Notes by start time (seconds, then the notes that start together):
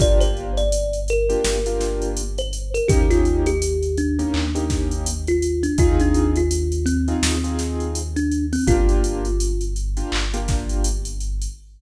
0.00 G1 A#3 D4 F4 G4 D5, kick, closed hi-hat
0.20 C5, closed hi-hat
0.37 closed hi-hat
0.57 D5, closed hi-hat
0.72 closed hi-hat
0.93 closed hi-hat
1.08 A#4, closed hi-hat
1.29 A#3 D4 F4 G4, closed hi-hat
1.44 G1, snare
1.66 A#3 D4 F4 G4, closed hi-hat
1.81 snare, closed hi-hat
2.02 closed hi-hat
2.17 closed hi-hat
2.38 C5, closed hi-hat
2.53 closed hi-hat
2.74 A#4, closed hi-hat
2.88 D#2 A#3 C#4 D#4 G4, kick, closed hi-hat
3.11 F4, snare, closed hi-hat
3.25 closed hi-hat
3.46 G4, closed hi-hat
3.62 closed hi-hat
3.83 closed hi-hat
3.97 D4, closed hi-hat
4.19 A#3 C#4 D#4 G4, closed hi-hat
4.34 D#2, clap
4.55 A#3 C#4 D#4 G4, closed hi-hat
4.70 kick, snare, closed hi-hat
4.91 closed hi-hat
5.06 closed hi-hat
5.27 F4, closed hi-hat
5.42 closed hi-hat
5.63 D4, closed hi-hat
5.78 D#2 C4 D#4 F4 G#4, kick, closed hi-hat
6.00 D4, closed hi-hat
6.14 closed hi-hat
6.36 F4, closed hi-hat
6.51 closed hi-hat
6.72 closed hi-hat
6.86 C4, closed hi-hat
7.08 C4 D#4 F4 G#4, closed hi-hat
7.23 D#2, snare
7.44 C4 D#4 F4 G#4, closed hi-hat
7.59 snare, closed hi-hat
7.80 closed hi-hat
7.95 closed hi-hat
8.16 D4, closed hi-hat
8.31 closed hi-hat
8.53 C4, open hi-hat
8.67 G1 A#3 D4 F4 G4, kick, closed hi-hat
8.89 closed hi-hat
9.04 closed hi-hat
9.25 closed hi-hat
9.40 closed hi-hat
9.61 closed hi-hat
9.76 closed hi-hat
9.97 A#3 D4 F4 G4, closed hi-hat
10.12 G1, clap
10.34 A#3 D4 F4 G4, closed hi-hat
10.48 kick, snare, closed hi-hat
10.69 closed hi-hat
10.84 closed hi-hat
11.05 closed hi-hat
11.20 closed hi-hat
11.42 closed hi-hat